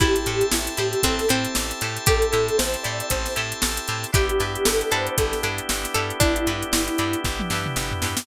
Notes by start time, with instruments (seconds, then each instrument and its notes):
0.00 electric bass (finger) A1, drawbar organ C4 E4 G4 A4 C5 E5 G5 A5, harpsichord E4, acoustic guitar (steel) E4 G4 A4 C5, electric piano 1 G4, kick, closed hi-hat
0.16 snare, closed hi-hat
0.26 electric bass (finger) A2, acoustic guitar (steel) E4 G4 A4 C5, closed hi-hat
0.41 closed hi-hat
0.52 electric bass (finger) A1, electric piano 1 E4, snare
0.67 closed hi-hat
0.77 electric bass (finger) A2, acoustic guitar (steel) E4 G4 A4 C5, electric piano 1 G4, closed hi-hat
0.93 closed hi-hat
1.03 electric bass (finger) A1, harpsichord C4, electric piano 1 A4, kick, closed hi-hat
1.19 snare, closed hi-hat
1.28 electric bass (finger) A2, harpsichord C4, acoustic guitar (steel) E4 G4 A4 C5, closed hi-hat
1.45 closed hi-hat
1.55 electric bass (finger) A1, snare
1.71 closed hi-hat
1.81 electric bass (finger) A2, acoustic guitar (steel) E4 G4 A4 C5, snare, closed hi-hat
1.97 closed hi-hat
2.06 electric bass (finger) A1, harpsichord G4, electric piano 1 A4, kick, closed hi-hat
2.22 closed hi-hat
2.32 electric bass (finger) A2, acoustic guitar (steel) E4 G4 A4 C5, closed hi-hat
2.48 closed hi-hat
2.58 electric bass (finger) A1, electric piano 1 C5, snare
2.74 closed hi-hat
2.83 electric bass (finger) A2, acoustic guitar (steel) E4 G4 A4 C5, electric piano 1 D5, closed hi-hat
3.00 closed hi-hat
3.10 electric bass (finger) A1, electric piano 1 C5, kick, closed hi-hat
3.26 snare, closed hi-hat
3.36 electric bass (finger) A2, acoustic guitar (steel) E4 G4 A4 C5, closed hi-hat
3.52 closed hi-hat
3.62 electric bass (finger) A1, snare
3.77 closed hi-hat
3.88 electric bass (finger) A2, acoustic guitar (steel) E4 G4 A4 C5, closed hi-hat
4.03 snare, closed hi-hat
4.12 electric bass (finger) G1, drawbar organ B3 D4 E4 G4, acoustic guitar (steel) D4 E4 G4 B4, harpsichord G4, electric piano 1 G4, kick, closed hi-hat
4.29 closed hi-hat
4.39 electric bass (finger) G2, acoustic guitar (steel) D4 E4 G4 B4, snare, closed hi-hat
4.55 closed hi-hat
4.65 electric bass (finger) G1, electric piano 1 A4, snare
4.81 closed hi-hat
4.91 electric bass (finger) G2, acoustic guitar (steel) D4 E4 G4 B4, harpsichord A4, electric piano 1 C5, closed hi-hat
5.07 closed hi-hat
5.18 electric bass (finger) G1, electric piano 1 A4, kick, closed hi-hat
5.33 snare, closed hi-hat
5.43 electric bass (finger) G2, acoustic guitar (steel) D4 E4 G4 B4, closed hi-hat
5.58 closed hi-hat
5.69 electric bass (finger) G1, snare
5.84 snare, closed hi-hat
5.94 electric bass (finger) G2, acoustic guitar (steel) D4 E4 G4 B4, harpsichord A4, closed hi-hat
6.10 closed hi-hat
6.20 electric bass (finger) G1, harpsichord D4, electric piano 1 E4, kick, closed hi-hat
6.36 closed hi-hat
6.47 electric bass (finger) G2, acoustic guitar (steel) D4 E4 G4 B4, closed hi-hat
6.62 closed hi-hat
6.73 electric bass (finger) G1, snare
6.88 closed hi-hat
6.98 electric bass (finger) G2, acoustic guitar (steel) D4 E4 G4 B4, closed hi-hat
7.13 closed hi-hat
7.24 electric bass (finger) G1, kick, snare
7.40 high tom
7.50 electric bass (finger) G2, acoustic guitar (steel) D4 E4 G4 B4, snare
7.66 mid tom
7.76 electric bass (finger) G1, snare
7.91 floor tom
8.02 electric bass (finger) G2, acoustic guitar (steel) D4 E4 G4 B4, snare
8.17 snare